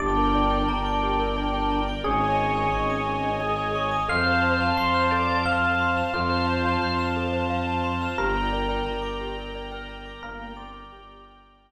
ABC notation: X:1
M:3/4
L:1/16
Q:1/4=88
K:Gdor
V:1 name="Electric Piano 1"
d12 | _A12 | f4 c'4 f4 | F12 |
B12 | B2 d6 z4 |]
V:2 name="Drawbar Organ"
D12 | _D8 _A4 | c4 c c d2 A2 z2 | c6 z6 |
z9 B B2 | B,2 C z G6 z2 |]
V:3 name="Glockenspiel"
G B d g b d' G B d g b d' | _A _d _e _a _d' _e' A d e a d' e' | A c f a c' f' A c f a c' f' | A c f a c' f' A c f a c' f' |
G B d g b d' G B d g b d' | z12 |]
V:4 name="Violin" clef=bass
G,,,4 G,,,8 | _A,,,4 A,,,8 | F,,4 F,,8 | F,,4 F,,8 |
G,,,4 G,,,8 | G,,,4 G,,,8 |]
V:5 name="String Ensemble 1"
[Bdg]12 | [_d_e_a]12 | [cfa]12 | [cfa]12 |
[dgb]12 | [dgb]12 |]